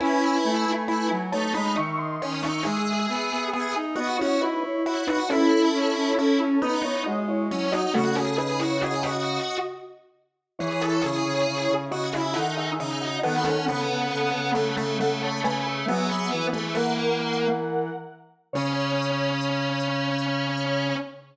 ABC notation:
X:1
M:3/4
L:1/16
Q:1/4=68
K:C#m
V:1 name="Lead 1 (square)"
[Bg]6 [ca] [db] [ec'] [d^b]2 [ec'] | [Ge]6 [Fd] [Ec] [DB] [Ec]2 [DB] | [CA]6 [DB] [Ec] [Fd] [Ec]2 [Fd] | [A,F] [CA] [DB] [Ec] [Fd] [Fd]3 z4 |
[Ec]6 [Fd] [Ge] [Af] [Ge]2 [Fd] | [Af]8 [Af] [ca] [Bg] [Ge] | [Ge]3 [Ge] [^Af]6 z2 | c12 |]
V:2 name="Lead 1 (square)"
E4 E z D D z2 C D | G4 G z F F z2 E F | E4 E z D D z2 C D | F G G F G F3 z4 |
G A G4 F E D2 D2 | B, C B,4 A, A, A,2 A,2 | B,3 A, ^A,4 z4 | C12 |]
V:3 name="Lead 1 (square)"
C2 A, A, A, F, A, G, D,2 D,2 | G,2 B, B, B, D B, C E2 F2 | E2 C C C C B, B, G,2 F,2 | C,8 z4 |
E,2 C, C, C, C, C, C, D,2 C,2 | D,2 C, C, C, C, C, C, C,2 C,2 | F,2 E,8 z2 | C,12 |]